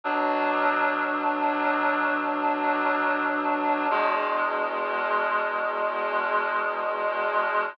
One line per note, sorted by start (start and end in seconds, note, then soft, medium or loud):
0.04 3.87 B2 medium
0.04 3.87 F#3 medium
0.04 3.87 D4 medium
3.90 7.74 E2 medium
3.90 7.74 B2 medium
3.90 7.74 G#3 medium